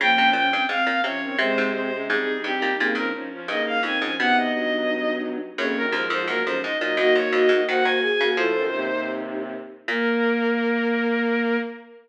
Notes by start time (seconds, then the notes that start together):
0.00 C#3 F3 A#3 C#4 G5
0.18 C3
0.33 A#2 C#4 G5
0.52 G2 C4
0.69 G#2 C4 F5
0.87 A#2
1.04 C3 F3 C#4 C#5
1.22 D#3 C4
1.38 C3 G#3 C4 C5
1.58 G#2
1.74 C4 C5
1.92 C3 G#3 C#4
2.08 G#2 G3 C4 D#4 G#4
2.43 G2 C4 G4
2.62 A#2
2.79 A#2 C#3 A#3 C4 D#4
2.95 G2 F3 C#4 A#4
3.14 F3 C#4 D#4
3.32 F3 C#4
3.48 G2 C#3 A#3 D#4 D#5
3.66 F5
3.83 F2 D#3 C4 D#4 G#5
4.01 G#2 F3 C#4
4.19 B2 C3 B3 D#4 F#5
4.38 D#5
4.53 G2 F#3 D#5
5.57 F2 F#2 C#3 A#3 C#4 C#5
5.75 F#2 D#3 A#4
5.92 D#2 G#2 F3 F4 A#4
6.10 F2 G#2 F3 C5
6.28 F#2 A#2 F#3 A#3 A#4
6.45 F2 G#2 F3 C#4 C5
6.62 G#2 D#4 D#5
6.80 A#2 F#3 D#4 D#5
6.96 F#2 A#3 D#4 F#4 D#5
7.15 F2 A#3 F#4 C#5
7.32 F2 A#3 F#4 D#5
7.49 G#2 A#3 F#4
7.68 D#3 A#3 F#4 C5 F#5
7.84 D#3 A#3 F#4 C5 G#5
8.01 G#4 G#5
8.20 C#3 A#3 F#4
8.36 A2 F3 F4 A4 C5
8.55 F#2 D#3
8.72 D#2 C3 D#4
8.92 D#2 C3
9.88 A#2 A#3 A#4